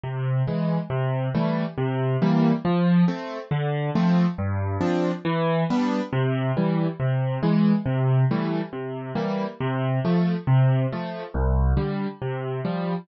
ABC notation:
X:1
M:6/8
L:1/8
Q:3/8=138
K:C
V:1 name="Acoustic Grand Piano"
C,3 [E,^G,]3 | C,3 [E,G,A,]3 | C,3 [E,G,_B,]3 | F,3 [A,C]3 |
D,3 [F,A,C]3 | G,,3 [F,CD]3 | E,3 [G,B,D]3 | C,3 [E,G,]3 |
C,3 [E,^G,]3 | C,3 [E,G,A,]3 | C,3 [E,G,_B,]3 | C,3 [F,A,]3 |
C,3 [F,A,]3 | C,,3 [D,G,]3 | C,3 [F,G,]3 |]